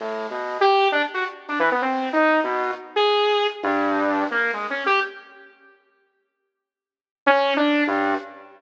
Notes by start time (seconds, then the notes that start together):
0.00 A2
0.30 B2
0.61 G4
0.92 D4
1.14 F#4
1.48 D4
1.59 E3
1.71 B3
1.82 C4
2.13 D#4
2.44 B2
2.96 G#4
3.63 G2
4.31 A#3
4.53 G#3
4.70 C#4
4.86 G4
7.26 C#4
7.56 D4
7.87 G2